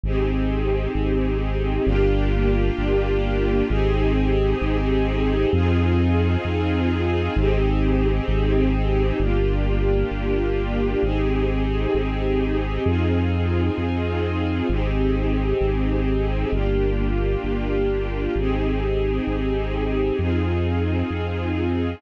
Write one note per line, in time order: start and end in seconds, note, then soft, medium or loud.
0.04 0.88 G#1 loud
0.04 1.86 C4 medium
0.04 1.86 D#4 medium
0.04 1.85 G4 medium
0.04 1.86 G#4 medium
0.95 1.79 G#1 loud
1.85 2.71 G1 loud
1.85 3.67 A#3 medium
1.85 3.67 D4 medium
1.85 3.67 F4 medium
1.85 3.67 G4 medium
2.79 3.63 G1 loud
3.69 4.54 G#1 loud
3.69 5.50 C4 medium
3.69 5.50 D#4 medium
3.69 5.50 G4 medium
3.69 5.50 G#4 medium
4.62 5.46 G#1 loud
5.53 6.37 F2 loud
5.53 7.34 C4 medium
5.53 7.34 D#4 medium
5.53 7.34 F4 medium
5.53 7.34 G#4 medium
6.45 7.29 F2 medium
7.36 8.21 G#1 loud
7.36 9.18 C4 loud
7.36 9.18 D#4 medium
7.36 9.18 G4 medium
7.36 9.18 G#4 medium
8.28 9.12 G#1 loud
9.20 10.04 G1 loud
9.20 11.01 A#3 medium
9.20 11.01 D4 medium
9.20 11.01 F4 medium
9.20 11.01 G4 medium
10.11 10.96 G1 medium
11.02 11.87 G#1 loud
11.02 12.83 C4 medium
11.02 12.83 D#4 medium
11.02 12.83 G4 medium
11.02 12.83 G#4 medium
11.94 12.79 G#1 medium
12.85 13.70 F2 loud
12.85 14.67 C4 medium
12.85 14.67 D#4 medium
12.85 14.67 F4 medium
12.85 14.67 G#4 medium
13.78 14.62 F2 medium
14.69 15.54 G#1 loud
14.69 16.50 C4 medium
14.69 16.50 D#4 medium
14.69 16.50 G4 medium
14.69 16.50 G#4 medium
15.61 16.45 G#1 loud
16.52 17.37 G1 loud
16.52 18.34 A#3 medium
16.52 18.34 D4 medium
16.52 18.34 F4 medium
16.52 18.34 G4 medium
17.44 18.28 G1 medium
18.36 19.20 G#1 loud
18.36 20.18 C4 medium
18.36 20.18 D#4 medium
18.36 20.18 G4 medium
18.36 20.18 G#4 medium
19.27 20.12 G#1 medium
20.19 21.03 F2 loud
20.19 22.00 C4 medium
20.19 22.00 D#4 medium
20.19 22.00 F4 medium
20.19 22.00 G#4 medium
21.11 21.95 F2 medium